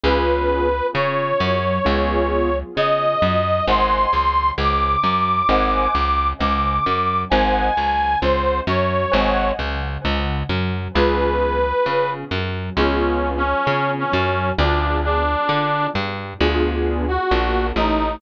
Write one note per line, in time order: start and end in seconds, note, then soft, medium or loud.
0.03 0.81 C#2 medium
0.03 0.67 B3 medium
0.03 0.67 C#4 medium
0.03 0.67 F4 medium
0.03 0.67 G#4 medium
0.03 0.87 B4 medium
0.94 1.33 C#3 medium
0.94 1.34 C#4 medium
0.94 2.56 C#5 medium
1.40 1.79 F#2 medium
1.40 1.78 F#3 medium
1.85 2.63 C#2 medium
1.85 2.49 B3 medium
1.85 2.49 C#4 medium
1.85 2.49 F4 medium
1.85 2.49 G#4 medium
2.77 3.16 C#3 medium
2.77 3.15 C#4 medium
2.77 3.65 D#5 medium
3.22 3.61 F#2 medium
3.22 3.61 F#3 medium
3.67 4.06 G#1 medium
3.67 4.09 C5 medium
3.67 4.09 D#5 medium
3.67 4.09 F#5 medium
3.67 4.09 G#5 medium
3.67 4.51 C6 medium
4.13 4.52 C#2 medium
4.13 4.52 C#3 medium
4.58 4.96 C#2 medium
4.58 4.97 C#3 medium
4.58 6.28 D6 medium
5.03 5.42 F#2 medium
5.03 5.43 F#3 medium
5.49 5.88 G#1 medium
5.49 5.90 C5 medium
5.49 5.90 D#5 medium
5.49 5.90 F#5 medium
5.49 5.90 G#5 medium
5.95 6.33 C#2 medium
5.95 6.33 C#3 medium
6.40 6.79 C#2 medium
6.40 6.80 C#3 medium
6.40 7.21 D6 soft
6.85 7.25 F#2 medium
6.85 7.24 F#3 medium
7.30 7.70 G#1 medium
7.30 7.72 C5 medium
7.30 7.72 D#5 medium
7.30 7.72 F#5 medium
7.30 8.18 G#5 medium
7.30 7.72 G#5 medium
7.77 8.16 C#2 medium
7.77 8.15 C#3 medium
8.22 8.61 C#2 medium
8.22 8.62 C#3 medium
8.22 8.60 C5 medium
8.67 9.06 F#2 medium
8.67 9.07 F#3 medium
8.67 9.51 C#5 medium
9.12 9.52 G#1 medium
9.12 9.53 C5 medium
9.12 9.53 D#5 medium
9.12 9.53 F#5 medium
9.12 9.53 G#5 medium
9.59 9.98 C#2 medium
9.59 9.98 C#3 medium
10.04 10.43 C#2 medium
10.04 10.43 C#3 medium
10.49 10.88 F#2 medium
10.49 10.88 F#3 medium
10.95 11.73 C#2 medium
10.95 11.59 B3 medium
10.95 11.59 C#4 medium
10.95 11.59 F4 medium
10.95 11.59 G#4 medium
10.95 12.10 B4 medium
11.86 12.25 C#3 medium
11.86 12.25 C#4 medium
12.31 12.70 F#2 medium
12.31 12.70 F#3 medium
12.77 13.54 C#2 medium
12.77 13.42 B3 medium
12.77 13.30 C#4 soft
12.77 13.42 C#4 medium
12.77 13.42 F4 medium
12.77 13.42 G#4 medium
13.37 13.91 C#4 medium
13.67 14.06 C#3 medium
13.67 14.07 C#4 medium
13.98 14.50 C#4 medium
14.12 14.52 F#2 medium
14.12 14.51 F#3 medium
14.58 15.36 D2 medium
14.58 15.22 B3 medium
14.58 15.22 D4 medium
14.58 14.98 D4 medium
14.58 15.22 F4 medium
14.58 15.22 G#4 medium
15.04 15.87 D4 medium
15.48 15.88 D3 medium
15.48 15.87 D4 medium
15.94 16.34 G2 medium
15.94 16.33 G3 medium
16.41 17.18 D2 medium
16.41 17.05 B3 medium
16.41 17.05 D4 medium
16.41 17.05 F4 medium
16.41 17.05 G#4 medium
17.08 17.67 F#4 medium
17.31 17.72 A#1 medium
17.31 17.73 A#3 medium
17.76 18.17 A1 medium
17.76 18.18 A3 medium
17.76 18.16 D#4 medium